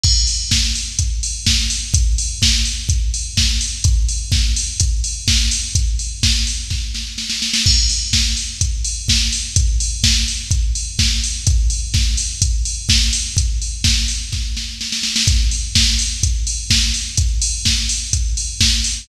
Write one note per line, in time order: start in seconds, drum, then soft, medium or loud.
0.04 kick loud
0.04 crash loud
0.27 open hi-hat medium
0.51 kick medium
0.51 snare loud
0.75 open hi-hat medium
0.99 kick medium
0.99 closed hi-hat loud
1.23 open hi-hat medium
1.46 kick medium
1.46 snare loud
1.70 open hi-hat medium
1.94 kick loud
1.94 closed hi-hat loud
2.18 open hi-hat medium
2.42 kick medium
2.42 snare loud
2.65 open hi-hat medium
2.89 kick medium
2.89 closed hi-hat medium
3.14 open hi-hat medium
3.37 kick medium
3.37 snare loud
3.61 open hi-hat medium
3.84 kick loud
3.84 closed hi-hat loud
4.09 open hi-hat medium
4.32 kick loud
4.32 snare medium
4.56 open hi-hat medium
4.80 kick medium
4.80 closed hi-hat loud
5.04 open hi-hat medium
5.28 kick medium
5.28 snare loud
5.51 open hi-hat medium
5.75 kick medium
5.75 closed hi-hat loud
5.99 open hi-hat medium
6.23 kick medium
6.23 snare loud
6.47 open hi-hat medium
6.70 kick medium
6.70 snare medium
6.95 snare medium
7.18 snare medium
7.30 snare medium
7.42 snare medium
7.54 snare loud
7.66 kick loud
7.66 crash loud
7.89 open hi-hat medium
8.13 kick medium
8.13 snare loud
8.37 open hi-hat medium
8.61 kick medium
8.61 closed hi-hat loud
8.85 open hi-hat medium
9.08 kick medium
9.08 snare loud
9.32 open hi-hat medium
9.56 kick loud
9.56 closed hi-hat loud
9.80 open hi-hat medium
10.04 kick medium
10.04 snare loud
10.28 open hi-hat medium
10.51 kick medium
10.51 closed hi-hat medium
10.75 open hi-hat medium
10.99 kick medium
10.99 snare loud
11.24 open hi-hat medium
11.47 kick loud
11.47 closed hi-hat loud
11.70 open hi-hat medium
11.94 kick loud
11.94 snare medium
12.17 open hi-hat medium
12.42 kick medium
12.42 closed hi-hat loud
12.65 open hi-hat medium
12.89 kick medium
12.89 snare loud
13.13 open hi-hat medium
13.37 kick medium
13.37 closed hi-hat loud
13.62 open hi-hat medium
13.84 kick medium
13.84 snare loud
14.08 open hi-hat medium
14.32 kick medium
14.32 snare medium
14.57 snare medium
14.81 snare medium
14.92 snare medium
15.03 snare medium
15.16 snare loud
15.27 kick loud
15.27 closed hi-hat loud
15.51 open hi-hat medium
15.75 kick medium
15.75 snare loud
15.99 open hi-hat medium
16.23 kick medium
16.23 closed hi-hat loud
16.47 open hi-hat medium
16.70 kick medium
16.70 snare loud
16.94 open hi-hat medium
17.17 kick loud
17.17 closed hi-hat loud
17.42 open hi-hat medium
17.65 kick medium
17.65 snare loud
17.89 open hi-hat medium
18.13 kick medium
18.13 closed hi-hat loud
18.37 open hi-hat medium
18.61 kick medium
18.61 snare loud
18.84 open hi-hat medium